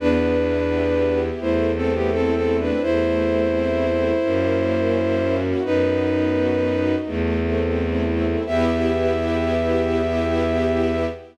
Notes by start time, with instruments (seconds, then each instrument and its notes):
0.00 violin E2 D4 B4, string ensemble 1 B3
0.37 string ensemble 1 E4
0.71 string ensemble 1 G4
1.07 string ensemble 1 E4
1.41 violin E2 E4 C5, string ensemble 1 A3
1.76 violin C4 A4, string ensemble 1 C4
1.94 violin B3 G4
2.12 violin C4 A4, string ensemble 1 E4
2.35 violin C4 A4
2.49 string ensemble 1 C4
2.59 violin D4 B4
2.82 violin E2 E4 C5, string ensemble 1 A3
3.18 string ensemble 1 C4
3.54 string ensemble 1 E4
3.88 string ensemble 1 C4
4.23 violin F#2, string ensemble 1 A#3
4.60 string ensemble 1 C#4
4.95 string ensemble 1 E4
5.30 string ensemble 1 F#4
5.63 violin F#2 D#4 B4, string ensemble 1 B3
6.00 string ensemble 1 D#4
6.34 string ensemble 1 F#4
6.71 string ensemble 1 D#4
7.05 violin E2, string ensemble 1 A3
7.41 string ensemble 1 C4
7.75 string ensemble 1 E4
8.11 string ensemble 1 C4
8.46 violin E2 E5, string ensemble 1 B3 E4 G4